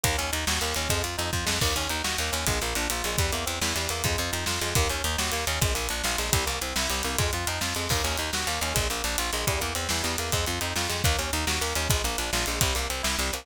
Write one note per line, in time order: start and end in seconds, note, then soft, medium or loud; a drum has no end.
0.04 0.16 D#2 loud
0.04 0.16 A#3 medium
0.04 kick loud
0.04 closed hi-hat loud
0.18 0.31 D#2 medium
0.18 0.31 C#4 medium
0.18 closed hi-hat medium
0.32 0.45 D#2 medium
0.32 0.45 D#4 medium
0.32 closed hi-hat loud
0.47 0.59 D#2 medium
0.47 0.61 F#4 medium
0.47 snare loud
0.61 0.74 D#2 medium
0.61 0.74 A#3 medium
0.61 closed hi-hat medium
0.75 0.88 D#2 medium
0.75 0.89 C#4 medium
0.75 closed hi-hat medium
0.89 1.02 F2 medium
0.89 1.02 G#3 medium
0.89 kick loud
0.89 closed hi-hat loud
1.03 1.16 F2 medium
1.03 1.16 F4 medium
1.03 closed hi-hat medium
1.18 1.31 F2 medium
1.18 1.31 D#4 medium
1.18 closed hi-hat medium
1.33 1.45 F2 medium
1.33 1.46 F4 medium
1.33 kick loud
1.46 1.59 F2 medium
1.46 1.59 G#3 medium
1.46 snare loud
1.61 1.73 D#2 medium
1.61 1.75 A#3 medium
1.61 kick loud
1.61 crash loud
1.76 1.88 D#2 medium
1.76 1.89 C#4 medium
1.76 closed hi-hat medium
1.89 2.02 D#2 medium
1.89 2.03 D#4 medium
1.89 closed hi-hat medium
2.04 2.17 D#2 medium
2.04 2.17 F#4 medium
2.04 snare loud
2.18 2.31 D#2 medium
2.18 2.33 A#3 medium
2.18 closed hi-hat medium
2.32 2.45 D#2 medium
2.32 2.45 C#4 medium
2.32 closed hi-hat loud
2.47 2.59 A#1 medium
2.47 2.60 G#3 medium
2.47 kick loud
2.47 closed hi-hat loud
2.61 2.74 A#1 medium
2.61 2.75 A#3 medium
2.61 closed hi-hat medium
2.75 2.88 A#1 medium
2.75 2.89 D4 medium
2.75 closed hi-hat medium
2.90 3.02 A#1 medium
2.90 3.04 F4 medium
2.90 closed hi-hat loud
3.04 3.16 A#1 medium
3.04 3.19 G#3 medium
3.04 closed hi-hat medium
3.18 3.31 E2 medium
3.18 3.31 G3 medium
3.18 kick loud
3.18 closed hi-hat loud
3.32 3.45 E2 medium
3.32 3.45 A#3 medium
3.32 closed hi-hat medium
3.46 3.59 E2 medium
3.46 3.59 C4 medium
3.46 closed hi-hat loud
3.61 3.74 E2 medium
3.61 3.75 E4 medium
3.61 snare loud
3.76 3.88 E2 medium
3.76 3.89 G3 medium
3.76 closed hi-hat medium
3.89 4.02 E2 medium
3.89 4.03 A#3 medium
3.89 closed hi-hat loud
4.04 4.16 F2 medium
4.04 4.18 G#3 medium
4.04 kick loud
4.04 closed hi-hat loud
4.18 4.31 F2 medium
4.18 4.32 F4 medium
4.18 closed hi-hat medium
4.32 4.45 F2 medium
4.32 4.45 D#4 medium
4.32 closed hi-hat loud
4.46 4.59 F2 medium
4.46 4.60 F4 medium
4.46 snare loud
4.61 4.74 F2 medium
4.61 4.74 G#3 medium
4.61 closed hi-hat medium
4.75 4.88 D#2 loud
4.75 4.89 A#3 medium
4.75 kick loud
4.75 closed hi-hat loud
4.90 5.02 D#2 medium
4.90 5.03 C#4 medium
4.90 closed hi-hat medium
5.04 5.16 D#2 medium
5.04 5.18 D#4 medium
5.04 closed hi-hat medium
5.18 5.31 D#2 medium
5.18 5.32 F#4 medium
5.18 snare loud
5.32 5.45 D#2 medium
5.32 5.45 A#3 medium
5.32 closed hi-hat medium
5.47 5.59 D#2 medium
5.47 5.60 C#4 medium
5.47 closed hi-hat loud
5.61 5.74 A#1 medium
5.61 5.74 G#3 medium
5.61 kick loud
5.61 closed hi-hat loud
5.74 5.88 A#1 medium
5.74 5.87 A#3 medium
5.74 closed hi-hat medium
5.89 6.02 A#1 medium
5.89 6.03 D4 medium
5.89 closed hi-hat loud
6.04 6.16 A#1 medium
6.04 6.18 F4 medium
6.04 snare loud
6.18 6.31 A#1 medium
6.18 6.31 G#3 medium
6.18 closed hi-hat medium
6.32 6.45 C2 medium
6.32 6.45 G3 medium
6.32 kick loud
6.32 closed hi-hat loud
6.46 6.59 C2 medium
6.46 6.59 A#3 medium
6.46 closed hi-hat medium
6.61 6.74 C2 medium
6.61 6.75 C4 medium
6.61 closed hi-hat loud
6.76 6.88 C2 medium
6.76 6.90 E4 medium
6.76 snare loud
6.90 7.02 C2 medium
6.90 7.03 G3 medium
6.90 closed hi-hat medium
7.03 7.17 C2 medium
7.03 7.17 A#3 medium
7.03 closed hi-hat loud
7.18 7.31 F2 medium
7.18 7.31 G#3 medium
7.18 kick loud
7.18 closed hi-hat loud
7.33 7.45 F2 medium
7.33 7.47 F4 medium
7.33 closed hi-hat medium
7.47 7.59 F2 medium
7.47 7.61 D#4 medium
7.47 closed hi-hat loud
7.61 7.74 F2 medium
7.61 7.74 F4 medium
7.61 snare loud
7.75 7.88 F2 medium
7.75 7.89 G#3 medium
7.75 closed hi-hat medium
7.89 8.02 D#2 medium
7.89 8.03 A#3 medium
7.89 kick loud
7.89 crash loud
8.04 8.16 D#2 medium
8.04 8.17 C#4 medium
8.04 closed hi-hat medium
8.17 8.31 D#2 medium
8.17 8.31 D#4 medium
8.17 closed hi-hat medium
8.33 8.45 D#2 medium
8.33 8.47 F#4 medium
8.33 snare loud
8.47 8.59 D#2 medium
8.47 8.60 A#3 medium
8.47 closed hi-hat medium
8.61 8.73 D#2 medium
8.61 8.75 C#4 medium
8.61 closed hi-hat loud
8.74 8.88 A#1 medium
8.74 8.87 G#3 medium
8.74 kick loud
8.74 closed hi-hat loud
8.90 9.02 A#1 medium
8.90 9.03 A#3 medium
8.90 closed hi-hat medium
9.04 9.16 A#1 medium
9.04 9.17 D4 medium
9.04 closed hi-hat medium
9.18 9.31 A#1 medium
9.18 9.31 F4 medium
9.18 closed hi-hat loud
9.33 9.45 A#1 medium
9.33 9.46 G#3 medium
9.33 closed hi-hat medium
9.47 9.59 E2 medium
9.47 9.60 G3 medium
9.47 kick loud
9.47 closed hi-hat loud
9.60 9.74 E2 medium
9.60 9.73 A#3 medium
9.60 closed hi-hat medium
9.75 9.88 E2 medium
9.75 9.88 C4 medium
9.75 closed hi-hat loud
9.89 10.02 E2 medium
9.89 10.04 E4 medium
9.89 snare loud
10.03 10.16 E2 medium
10.03 10.16 G3 medium
10.03 closed hi-hat medium
10.18 10.31 E2 medium
10.18 10.32 A#3 medium
10.18 closed hi-hat loud
10.32 10.45 F2 medium
10.32 10.45 G#3 medium
10.32 kick loud
10.32 closed hi-hat loud
10.46 10.59 F2 medium
10.46 10.60 F4 medium
10.46 closed hi-hat medium
10.61 10.74 F2 medium
10.61 10.74 D#4 medium
10.61 closed hi-hat loud
10.76 10.88 F2 medium
10.76 10.90 F4 medium
10.76 snare loud
10.89 11.02 F2 medium
10.89 11.02 G#3 medium
10.89 closed hi-hat medium
11.04 11.16 D#2 loud
11.04 11.18 A#3 medium
11.04 kick loud
11.04 closed hi-hat loud
11.19 11.31 D#2 medium
11.19 11.31 C#4 medium
11.19 closed hi-hat medium
11.33 11.45 D#2 medium
11.33 11.46 D#4 medium
11.33 closed hi-hat medium
11.47 11.59 D#2 medium
11.47 11.60 F#4 medium
11.47 snare loud
11.61 11.74 D#2 medium
11.61 11.74 A#3 medium
11.61 closed hi-hat medium
11.75 11.88 D#2 medium
11.75 11.88 C#4 medium
11.75 closed hi-hat loud
11.90 12.02 A#1 medium
11.90 12.03 G#3 medium
11.90 kick loud
11.90 closed hi-hat loud
12.04 12.16 A#1 medium
12.04 12.17 A#3 medium
12.04 closed hi-hat medium
12.18 12.31 A#1 medium
12.18 12.31 D4 medium
12.18 closed hi-hat loud
12.33 12.45 A#1 medium
12.33 12.46 F4 medium
12.33 snare loud
12.46 12.59 A#1 medium
12.46 12.60 G#3 medium
12.46 closed hi-hat medium
12.61 12.74 C2 medium
12.61 12.75 G3 medium
12.61 kick loud
12.61 closed hi-hat loud
12.75 12.88 C2 medium
12.75 12.88 A#3 medium
12.75 closed hi-hat medium
12.89 13.02 C2 medium
12.89 13.02 C4 medium
12.89 closed hi-hat loud
13.03 13.16 C2 medium
13.03 13.16 E4 medium
13.03 snare loud
13.19 13.31 C2 medium
13.19 13.32 G3 medium
13.19 closed hi-hat medium
13.33 13.45 C2 medium
13.33 13.46 A#3 medium
13.33 closed hi-hat loud